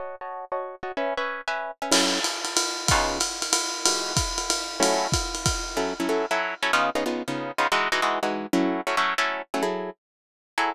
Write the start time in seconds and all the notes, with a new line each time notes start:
0.00 F#4 C#5 D#5 A5
0.21 F#4 C#5 D#5 A5
0.52 F#4 C#5 D#5 A5
0.83 F#4 C#5 D#5 A5
0.97 C#4 B4 E5 G#5
1.17 C#4 B4 E5 G#5
1.48 C#4 B4 E5 G#5
1.82 C#4 B4 E5 G#5
1.92 F#3 C#4 E4 A4, crash, ride
2.24 hi-hat pedal, ride
2.45 ride
2.57 ride
2.88 C#3 B3 D#4 F4, kick, ride
3.20 hi-hat pedal, ride
3.42 ride
3.53 ride
3.85 E3 G#3 D#4 F#4, ride
4.17 kick, hi-hat pedal, ride
4.38 ride
4.50 ride
4.80 F#3 A3 C#4 E4, ride
5.12 kick, hi-hat pedal, ride
5.35 ride
5.46 kick, ride
5.77 F#3 C#4 E4 A4
6.00 F#3 C#4 E4 A4
6.09 F#3 C#4 E4 A4
6.31 F#3 C#4 E4 A4
6.63 F#3 C#4 E4 A4
6.73 C#3 B3 D#4 F4
6.95 C#3 B3 D#4 F4
7.06 C#3 B3 D#4 F4
7.28 C#3 B3 D#4 F4
7.58 C#3 B3 D#4 F4
7.72 E3 G#3 D#4 F#4
7.92 E3 G#3 D#4 F#4
8.02 E3 G#3 D#4 F#4
8.23 E3 G#3 D#4 F#4
8.53 F#3 A3 C#4 E4
8.87 F#3 A3 C#4 E4
8.97 F#3 A3 C#4 E4
9.18 F#3 A3 C#4 E4
9.54 F#3 A3 C#4 E4
9.63 F#3 E4 G#4 A4
10.58 F#3 E4 G#4 A4